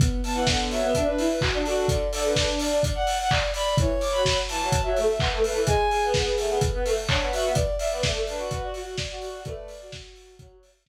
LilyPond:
<<
  \new Staff \with { instrumentName = "Violin" } { \time 4/4 \key b \dorian \tempo 4 = 127 r8 a''16 fis''16 fis''16 r16 e''8 e''16 b'8 b'16 r8 fis'8 | r8 a'16 b'16 b'16 r16 d''8 d''16 fis''8 fis''16 r8 b''8 | r8 d'''16 b''16 b''16 r16 a''8 a''16 e''8 e''16 r8 b'8 | gis''4 r2. |
r8 e''16 d''16 d''16 r16 b'8 b'16 fis'8 fis'16 r8 fis'8 | d''4 r2. | }
  \new Staff \with { instrumentName = "Violin" } { \time 4/4 \key b \dorian b8 b4~ b16 b16 r16 d'16 r8 fis'8 a'8 | d''8 d''4~ d''16 d''16 r16 d''16 r8 d''8 d''8 | cis''4 r2. | gis'8 gis'4~ gis'16 gis'16 r16 b'16 r8 cis''8 e''8 |
d''8 d''4~ d''16 d''16 r16 d''16 r8 d''8 d''8 | b'8. fis'4~ fis'16 r2 | }
  \new Staff \with { instrumentName = "Violin" } { \time 4/4 \key b \dorian r8. e16 d8 fis16 b16 d'8 e'16 r8 d'8. | d16 r16 d8 d'4 r2 | e16 r8 fis8. e16 fis16 r16 fis16 a16 r16 b16 a16 a16 e16 | gis16 r8 b8. a16 b16 r16 b16 a16 r16 d'16 b16 fis'16 b16 |
r8. b16 a8 d'16 fis'16 fis'8 fis'16 r8 fis'8. | a8 r4. fis8 r4. | }
  \new DrumStaff \with { instrumentName = "Drums" } \drummode { \time 4/4 <hh bd>8 hho8 <bd sn>8 hho8 <hh bd>8 hho8 <hc bd>8 hho8 | <hh bd>8 hho8 <bd sn>8 hho8 <hh bd>8 hho8 <hc bd>8 hho8 | <hh bd>8 hho8 <bd sn>8 hho8 <hh bd>8 hho8 <hc bd>8 hho8 | <hh bd>8 hho8 <bd sn>8 hho8 <hh bd>8 hho8 <hc bd>8 hho8 |
<hh bd>8 hho8 <bd sn>8 hho8 <hh bd>8 hho8 <bd sn>8 hho8 | <hh bd>8 hho8 <bd sn>8 hho8 <hh bd>8 hho8 <bd sn>4 | }
>>